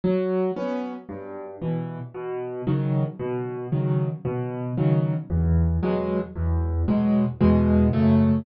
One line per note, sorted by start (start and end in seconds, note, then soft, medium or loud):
0.04 0.51 F#3 loud
0.56 0.93 B3 medium
0.56 0.93 C#4 medium
1.09 1.56 G2 medium
1.61 1.98 B2 medium
1.61 1.98 E3 medium
2.14 2.61 B2 medium
2.67 3.04 C#3 medium
2.67 3.04 D#3 medium
2.67 3.04 F#3 medium
3.19 3.67 B2 loud
3.72 4.09 C#3 medium
3.72 4.09 D#3 medium
3.72 4.09 F#3 medium
4.25 4.72 B2 medium
4.77 5.14 C#3 medium
4.77 5.14 D#3 medium
4.77 5.14 F#3 medium
5.30 5.77 E2 medium
5.82 6.19 B2 medium
5.82 6.19 F#3 medium
5.82 6.19 G#3 medium
6.35 6.83 E2 loud
6.88 7.25 B2 medium
6.88 7.25 F#3 medium
6.88 7.25 G#3 medium
7.40 7.88 E2 loud
7.40 7.88 B2 loud
7.40 7.88 G#3 medium
7.93 8.40 F#2 loud
7.93 8.40 C#3 loud
7.93 8.40 A3 loud